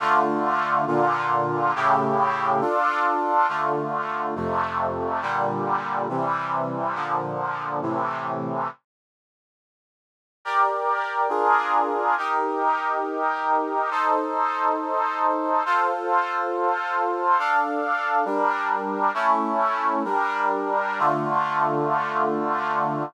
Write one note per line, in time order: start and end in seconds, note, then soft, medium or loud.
0.00 0.86 D3 medium
0.00 0.86 A3 medium
0.00 0.86 F4 medium
0.87 1.73 A#2 medium
0.87 1.73 D3 medium
0.87 1.73 F4 medium
1.75 2.61 A2 medium
1.75 2.61 C#3 medium
1.75 2.61 E4 medium
1.75 2.61 G4 medium
2.61 3.47 D4 medium
2.61 3.47 F4 medium
2.61 3.47 A4 medium
3.48 4.34 D3 medium
3.48 4.34 A3 medium
3.48 4.34 F4 medium
4.35 5.21 F2 medium
4.35 5.21 C3 medium
4.35 5.21 A3 medium
5.22 6.08 A#2 medium
5.22 6.08 D3 medium
5.22 6.08 G3 medium
6.09 6.95 C3 medium
6.09 6.95 E3 medium
6.09 6.95 G3 medium
6.95 7.81 A#2 medium
6.95 7.81 D3 medium
6.95 7.81 F3 medium
7.82 8.68 A2 medium
7.82 8.68 C3 medium
7.82 8.68 E3 medium
10.45 11.31 G4 medium
10.45 11.29 A#4 medium
10.45 11.31 D5 medium
11.29 12.15 D4 medium
11.29 12.15 F4 medium
11.29 12.15 G#4 medium
11.29 12.15 A#4 medium
12.18 13.90 D#4 medium
12.18 13.90 G4 medium
12.18 13.90 A#4 medium
13.91 15.63 D#4 medium
13.91 15.63 A4 medium
13.91 15.63 C5 medium
15.65 17.38 F4 medium
15.65 17.38 A4 medium
15.65 17.38 C5 medium
17.39 18.25 D4 medium
17.39 18.25 A4 medium
17.39 18.25 F5 medium
18.25 19.11 G3 medium
18.25 19.11 D4 medium
18.25 19.11 A#4 medium
19.14 20.03 A3 medium
19.14 20.03 C#4 medium
19.14 20.03 E4 medium
20.04 21.00 G3 medium
20.04 21.00 D4 medium
20.04 21.00 A#4 medium
20.99 23.03 D3 medium
20.99 23.03 A3 medium
20.99 23.03 F4 medium